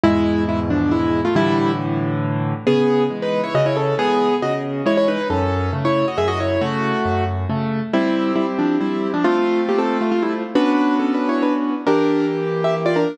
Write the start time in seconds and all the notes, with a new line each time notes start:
0.03 E2 G#2 B2 G#3 E4
0.49 G#3 E4
0.70 F3 D4
0.91 G#3 E4
1.25 A3 F4
1.35 A2 D3 E3 G3 E4
2.67 C#3 B3 G#4
3.10 E3 G#3
3.22 D#4 B4
3.44 E4 C#5
3.54 C#3 F#4 D#5
3.66 E4 C#5
3.77 C#4 A4
3.98 E3 G#3 B3 G#4
4.42 C#3 F#4 D#5
4.86 E3 G#3 E4 C#5
4.97 E4 C#5
5.08 D#4 B4
5.30 F#2 C#4 A4
5.73 C#3 A3
5.85 E4 C#5
6.08 F#4 D#5
6.18 F#2 G#4 E5
6.28 F#4 D#5
6.40 E4 C#5
6.61 C#3 A3 F#4
7.05 F#2
7.50 C#3 A3
7.93 G3 C4 E4 G4
8.36 G3 E4
8.59 F3 D4
8.81 G3 E4
9.14 F3 D4
9.24 A3 C4 F4
9.69 A#3 G4
9.78 C4 A4
10.01 A3 F4
10.11 A3 F4
10.22 G3 E4
10.55 B3 C#4 D4 F#4 B4
10.99 C#4 A4
11.14 D4 B4
11.29 E4 C#5
11.42 D4 B4
11.87 E3 A#3 D4 G4 A#4
12.64 G4 E5
12.86 F4 D5
12.96 D4 A#4